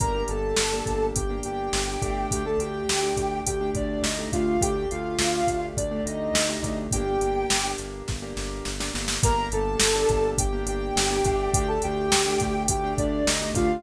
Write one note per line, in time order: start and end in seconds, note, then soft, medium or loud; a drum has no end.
0.00 0.24 G1 medium
0.00 0.11 A#3 medium
0.00 0.11 D4 medium
0.00 0.11 G4 medium
0.00 0.23 A#4 medium
0.00 0.23 A#5 loud
0.00 kick loud
0.00 closed hi-hat medium
0.15 0.61 A#3 medium
0.15 0.61 D4 medium
0.15 0.61 G4 medium
0.28 0.54 G1 loud
0.28 1.06 A4 medium
0.28 1.06 A5 medium
0.28 closed hi-hat medium
0.56 0.83 G1 medium
0.56 snare loud
0.72 1.18 A#3 medium
0.72 1.18 D4 medium
0.72 1.18 G4 medium
0.86 1.12 G1 medium
0.86 kick medium
0.86 closed hi-hat medium
1.15 1.40 G1 medium
1.15 1.38 G4 medium
1.15 1.38 G5 medium
1.15 kick medium
1.15 closed hi-hat medium
1.30 1.76 A#3 medium
1.30 1.76 D4 medium
1.30 1.76 G4 medium
1.43 1.70 G1 medium
1.43 2.27 G4 medium
1.43 2.27 G5 medium
1.43 closed hi-hat medium
1.73 1.98 G1 loud
1.73 snare medium
1.88 1.99 A#3 medium
1.88 1.99 D4 medium
1.88 1.99 G4 medium
2.02 2.27 G1 medium
2.02 2.42 A3 medium
2.02 2.42 D4 medium
2.02 2.42 G4 medium
2.02 kick medium
2.02 closed hi-hat medium
2.31 2.56 D2 medium
2.31 2.45 G4 medium
2.31 2.45 G5 loud
2.31 kick medium
2.31 closed hi-hat medium
2.45 2.91 A3 medium
2.45 2.91 D4 medium
2.45 2.91 G4 medium
2.45 2.59 A4 medium
2.45 2.59 A5 medium
2.58 2.83 D2 medium
2.58 3.39 G4 medium
2.58 3.39 G5 loud
2.58 closed hi-hat medium
2.88 3.13 D2 medium
2.88 snare loud
3.03 3.49 A3 medium
3.03 3.49 D4 medium
3.03 3.49 G4 medium
3.17 3.41 D2 medium
3.17 kick medium
3.17 closed hi-hat medium
3.46 3.72 D2 medium
3.46 3.70 G4 medium
3.46 3.70 G5 loud
3.46 kick medium
3.46 closed hi-hat loud
3.61 4.07 A3 medium
3.61 4.07 D4 medium
3.61 4.07 G4 medium
3.74 3.98 D2 medium
3.74 4.02 D4 medium
3.74 4.02 D5 medium
3.74 kick medium
3.74 closed hi-hat medium
4.02 4.27 D2 medium
4.02 4.28 D#4 medium
4.02 4.28 D#5 medium
4.02 snare medium
4.18 4.30 A3 medium
4.18 4.30 D4 medium
4.18 4.30 G4 medium
4.32 4.57 D2 loud
4.32 4.56 A3 medium
4.32 4.56 D4 medium
4.32 4.60 F4 medium
4.32 4.56 G4 medium
4.32 4.60 F5 medium
4.32 kick medium
4.32 closed hi-hat medium
4.61 4.86 D2 loud
4.61 4.73 A3 medium
4.61 4.73 D4 medium
4.61 4.73 G4 medium
4.61 4.88 G4 medium
4.61 4.88 G5 loud
4.61 kick medium
4.61 closed hi-hat loud
4.76 5.22 A3 medium
4.76 5.22 D4 medium
4.76 5.22 G4 medium
4.91 5.17 D2 medium
4.91 5.65 F4 medium
4.91 5.65 F5 medium
4.91 closed hi-hat medium
5.19 5.43 D2 loud
5.19 snare loud
5.33 5.80 A3 medium
5.33 5.80 D4 medium
5.33 5.80 G4 medium
5.47 5.72 D2 medium
5.47 kick medium
5.47 closed hi-hat medium
5.77 6.01 D2 medium
5.77 6.01 D4 medium
5.77 6.01 D5 medium
5.77 kick medium
5.77 closed hi-hat medium
5.91 6.37 A3 medium
5.91 6.37 D4 medium
5.91 6.37 G4 medium
6.06 6.30 D2 medium
6.06 6.78 D#4 medium
6.06 6.78 D#5 medium
6.06 closed hi-hat medium
6.34 6.58 D2 medium
6.34 snare loud
6.49 6.60 A3 medium
6.49 6.60 D4 medium
6.49 6.60 G4 medium
6.62 6.87 D2 medium
6.62 6.87 A3 medium
6.62 6.87 D4 medium
6.62 6.87 G4 medium
6.62 kick medium
6.62 closed hi-hat medium
6.91 7.17 G1 loud
6.91 7.04 A#3 medium
6.91 7.04 D4 medium
6.91 7.04 G4 medium
6.91 7.72 G4 loud
6.91 7.72 G5 loud
6.91 kick medium
6.91 closed hi-hat loud
7.06 7.53 A#3 medium
7.06 7.53 D4 medium
7.06 7.53 G4 medium
7.21 7.45 G1 medium
7.21 closed hi-hat medium
7.50 7.75 G1 medium
7.50 snare loud
7.64 8.10 A#3 medium
7.64 8.10 D4 medium
7.64 8.10 G4 medium
7.78 8.03 G1 medium
7.78 closed hi-hat medium
8.08 8.34 G1 medium
8.08 kick medium
8.08 snare medium
8.22 8.69 A#3 medium
8.22 8.69 D4 medium
8.22 8.69 G4 medium
8.37 8.62 G1 medium
8.37 snare medium
8.65 8.91 G1 medium
8.65 snare medium
8.80 8.91 A#3 medium
8.80 8.91 D4 medium
8.80 8.91 G4 medium
8.80 snare medium
8.94 9.19 G1 medium
8.94 9.17 A#3 medium
8.94 9.17 D4 medium
8.94 9.17 G4 medium
8.94 snare medium
9.08 snare medium
9.23 9.49 G1 loud
9.23 9.35 A#3 medium
9.23 9.35 D4 medium
9.23 9.35 G4 medium
9.23 9.47 A#4 loud
9.23 9.47 A#5 loud
9.23 kick loud
9.23 closed hi-hat loud
9.37 9.83 A#3 medium
9.37 9.83 D4 medium
9.37 9.83 G4 medium
9.52 9.76 G1 loud
9.52 10.30 A4 medium
9.52 10.30 A5 loud
9.52 closed hi-hat medium
9.80 10.05 G1 medium
9.80 snare loud
9.95 10.41 A#3 medium
9.95 10.41 D4 medium
9.95 10.41 G4 medium
10.09 10.34 G1 loud
10.09 kick medium
10.09 closed hi-hat medium
10.38 10.63 G1 medium
10.38 10.62 G4 medium
10.38 10.62 G5 loud
10.38 kick medium
10.38 closed hi-hat loud
10.53 10.99 A#3 medium
10.53 10.99 D4 medium
10.53 10.99 G4 medium
10.66 10.91 G1 medium
10.66 11.51 G4 loud
10.66 11.51 G5 loud
10.66 closed hi-hat medium
10.96 11.21 G1 loud
10.96 snare loud
11.10 11.22 A#3 medium
11.10 11.22 D4 medium
11.10 11.22 G4 medium
11.24 11.48 G1 medium
11.24 11.66 A3 medium
11.24 11.66 D4 loud
11.24 11.66 G4 loud
11.24 kick medium
11.24 closed hi-hat medium
11.54 11.79 D2 loud
11.54 11.68 G4 loud
11.54 11.68 G5 loud
11.54 kick loud
11.54 closed hi-hat loud
11.68 12.15 A3 medium
11.68 12.15 D4 medium
11.68 12.15 G4 medium
11.68 11.81 A4 medium
11.68 11.81 A5 loud
11.82 12.09 D2 loud
11.82 12.62 G4 loud
11.82 12.62 G5 loud
11.82 closed hi-hat medium
12.12 12.37 D2 medium
12.12 snare loud
12.26 12.72 A3 medium
12.26 12.72 D4 medium
12.26 12.72 G4 medium
12.40 12.67 D2 loud
12.40 kick medium
12.40 closed hi-hat medium
12.68 12.94 D2 loud
12.68 12.94 G4 loud
12.68 12.94 G5 loud
12.68 kick medium
12.68 closed hi-hat loud
12.84 13.30 A3 medium
12.84 13.30 D4 medium
12.84 13.30 G4 medium
12.98 13.23 D2 medium
12.98 13.25 D4 medium
12.98 13.25 D5 loud
12.98 kick medium
12.98 closed hi-hat medium
13.26 13.50 D2 medium
13.26 13.50 D#4 medium
13.26 13.50 D#5 loud
13.26 snare loud
13.41 13.53 A3 medium
13.41 13.53 D4 medium
13.41 13.53 G4 medium
13.54 13.79 D2 loud
13.54 13.79 A3 medium
13.54 13.79 D4 medium
13.54 13.83 F4 medium
13.54 13.79 G4 medium
13.54 13.83 F5 loud
13.54 kick medium
13.54 closed hi-hat medium